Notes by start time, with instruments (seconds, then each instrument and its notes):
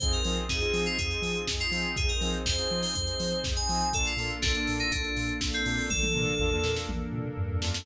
0.00 synth bass 2 F2, pad 2 (warm) C4 D#4 F4 G#4, lead 2 (sawtooth) C4 D#4 F4 G#4, electric piano 2 C5, kick, closed hi-hat
0.12 electric piano 2 A#4, closed hi-hat
0.24 synth bass 2 F3, lead 2 (sawtooth) C4 D#4 F4 G#4, open hi-hat
0.37 closed hi-hat
0.49 synth bass 2 F2, lead 2 (sawtooth) C4 D#4 F4 G#4, electric piano 2 G#4, kick, snare
0.61 lead 2 (sawtooth) C4 D#4 F4 G#4, closed hi-hat
0.73 synth bass 2 F3, open hi-hat
0.86 electric piano 2 F4, closed hi-hat
0.98 synth bass 2 F2, electric piano 2 G#4, kick, closed hi-hat
1.11 closed hi-hat
1.22 synth bass 2 F3, open hi-hat
1.35 closed hi-hat
1.47 synth bass 2 F2, kick, snare
1.60 electric piano 2 F4, closed hi-hat
1.71 synth bass 2 F3, lead 2 (sawtooth) C4 D#4 F4 G#4, open hi-hat
1.84 closed hi-hat
1.96 synth bass 2 F2, pad 2 (warm) C4 D#4 G#4 C5, electric piano 2 G#4, kick, closed hi-hat
2.09 electric piano 2 A#4, closed hi-hat
2.21 synth bass 2 F3, lead 2 (sawtooth) C4 D#4 F4 G#4, open hi-hat
2.34 closed hi-hat
2.46 synth bass 2 F2, lead 2 (sawtooth) C4 D#4 F4 G#4, electric piano 2 C5, kick, snare
2.58 lead 2 (sawtooth) C4 D#4 F4 G#4, closed hi-hat
2.71 synth bass 2 F3
2.83 electric piano 2 C5, open hi-hat
2.95 synth bass 2 F2, electric piano 2 C5, kick, closed hi-hat
3.07 closed hi-hat
3.20 synth bass 2 F3, open hi-hat
3.32 closed hi-hat
3.44 synth bass 2 F2, kick, snare
3.56 electric piano 2 G#5, closed hi-hat
3.69 synth bass 2 F3, lead 2 (sawtooth) C4 D#4 F4 G#4, open hi-hat
3.81 closed hi-hat
3.93 synth bass 2 A#1, lead 2 (sawtooth) A#3 D4 F4 A4, pad 2 (warm) A#3 D4 F4 A4, electric piano 2 A4, kick, closed hi-hat
4.05 electric piano 2 F4, closed hi-hat
4.17 synth bass 2 A#2, lead 2 (sawtooth) A#3 D4 F4 A4, open hi-hat
4.30 closed hi-hat
4.42 synth bass 2 A#1, lead 2 (sawtooth) A#3 D4 F4 A4, electric piano 2 D4, kick, snare
4.55 lead 2 (sawtooth) A#3 D4 F4 A4, closed hi-hat
4.67 synth bass 2 A#2, open hi-hat
4.79 electric piano 2 D#4, closed hi-hat
4.91 synth bass 2 A#1, electric piano 2 D4, kick, closed hi-hat
5.04 closed hi-hat
5.16 synth bass 2 A#2, open hi-hat
5.29 closed hi-hat
5.41 synth bass 2 A#1, kick, snare
5.53 electric piano 2 C4, closed hi-hat
5.65 synth bass 2 A#2, lead 2 (sawtooth) A#3 D4 F4 A4, open hi-hat
5.78 open hi-hat
5.90 synth bass 2 A#1, pad 2 (warm) A#3 D4 A4 A#4, electric piano 2 A4, kick, high tom
6.03 high tom
6.14 synth bass 2 A#2, lead 2 (sawtooth) A#3 D4 F4 A4, mid tom
6.27 mid tom
6.40 synth bass 2 A#1, lead 2 (sawtooth) A#3 D4 F4 A4, floor tom
6.52 lead 2 (sawtooth) A#3 D4 F4 A4, floor tom
6.64 synth bass 2 A#2, snare
6.76 snare
6.89 synth bass 2 A#1, high tom
7.12 synth bass 2 A#2, mid tom
7.25 mid tom
7.38 synth bass 2 G2, floor tom
7.50 floor tom
7.62 synth bass 2 F#2, lead 2 (sawtooth) A#3 D4 F4 A4, snare
7.74 snare